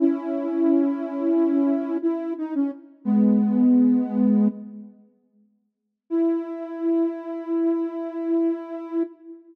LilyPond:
\new Staff { \time 9/8 \key e \major \tempo 4. = 59 <cis' e'>2. e'8 dis'16 cis'16 r8 | <gis b>2~ <gis b>8 r2 | e'1~ e'8 | }